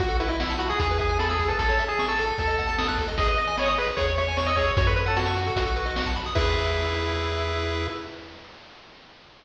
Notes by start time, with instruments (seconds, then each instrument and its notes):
0.00 synth bass 1 B1, lead 1 (square) F#4, kick, closed hi-hat
0.08 lead 1 (square) A4, closed hi-hat
0.20 lead 1 (square) E4 B4, closed hi-hat
0.28 lead 1 (square) E4 D#5, closed hi-hat
0.40 lead 1 (square) F#5, snare
0.50 lead 1 (square) A5, closed hi-hat
0.59 lead 1 (square) F#4 B5, closed hi-hat
0.69 lead 1 (square) G#4 D#6, closed hi-hat
0.79 synth bass 1 E2, lead 1 (square) G#4, kick, closed hi-hat
0.89 lead 1 (square) B4, closed hi-hat
0.99 lead 1 (square) G#4 E5, kick, closed hi-hat
1.09 lead 1 (square) G#5, closed hi-hat
1.19 lead 1 (square) A4 B5, snare
1.29 lead 1 (square) G#4 E6, closed hi-hat
1.39 lead 1 (square) G#4, kick, closed hi-hat
1.48 lead 1 (square) A4 B4, closed hi-hat
1.59 synth bass 1 A1, lead 1 (square) A4, kick, closed hi-hat
1.69 lead 1 (square) C#5, closed hi-hat
1.79 lead 1 (square) E5, closed hi-hat
1.88 lead 1 (square) G#4 A5, closed hi-hat
1.99 lead 1 (square) C#6, snare
2.08 lead 1 (square) A4 E6, closed hi-hat
2.18 lead 1 (square) A4, closed hi-hat
2.28 closed hi-hat
2.38 synth bass 1 D#2, lead 1 (square) A4, kick, closed hi-hat
2.47 lead 1 (square) D#5, closed hi-hat
2.58 lead 1 (square) F#5, kick, closed hi-hat
2.67 lead 1 (square) A5, closed hi-hat
2.78 lead 1 (square) D#6, snare
2.88 lead 1 (square) F#6, kick, closed hi-hat
2.98 lead 1 (square) A4, kick, closed hi-hat
3.08 lead 1 (square) D#5, closed hi-hat
3.17 synth bass 1 G#1, lead 1 (square) G#4 D#5, kick, closed hi-hat
3.27 lead 1 (square) B4 D#5, closed hi-hat
3.37 lead 1 (square) D#5, closed hi-hat
3.47 lead 1 (square) G#5, closed hi-hat
3.57 lead 1 (square) C#5 B5, snare
3.66 lead 1 (square) D#5 D#6, closed hi-hat
3.77 lead 1 (square) G#4 B4, closed hi-hat
3.87 lead 1 (square) B4, closed hi-hat
3.96 synth bass 1 E2, lead 1 (square) G#4 C#5, kick, closed hi-hat
4.07 lead 1 (square) C#5, closed hi-hat
4.17 lead 1 (square) C#5 E5, closed hi-hat
4.27 lead 1 (square) G#5, closed hi-hat
4.37 lead 1 (square) C#5 C#6, snare
4.46 lead 1 (square) D#5 E6, closed hi-hat
4.55 lead 1 (square) G#4 C#5, kick, closed hi-hat
4.67 lead 1 (square) C#5, closed hi-hat
4.77 synth bass 1 F#2, lead 1 (square) F#4 C#5, kick, closed hi-hat
4.87 lead 1 (square) A4 B4, closed hi-hat
4.96 lead 1 (square) B4 C#5, closed hi-hat
5.06 lead 1 (square) A4 F#5, closed hi-hat
5.16 lead 1 (square) F#4 A5, snare
5.26 lead 1 (square) C#6, closed hi-hat
5.35 lead 1 (square) F#4, closed hi-hat
5.46 lead 1 (square) A4, closed hi-hat
5.56 synth bass 1 B1, lead 1 (square) F#4, kick, closed hi-hat
5.66 lead 1 (square) A4, closed hi-hat
5.76 lead 1 (square) B4, closed hi-hat
5.86 lead 1 (square) D#5, closed hi-hat
5.96 lead 1 (square) F#5, snare
6.06 lead 1 (square) A5, kick, closed hi-hat
6.16 lead 1 (square) B5, kick, closed hi-hat
6.26 lead 1 (square) D#6, closed hi-hat
6.35 synth bass 1 E2, lead 1 (square) E4 G#4 B4 E5, kick, crash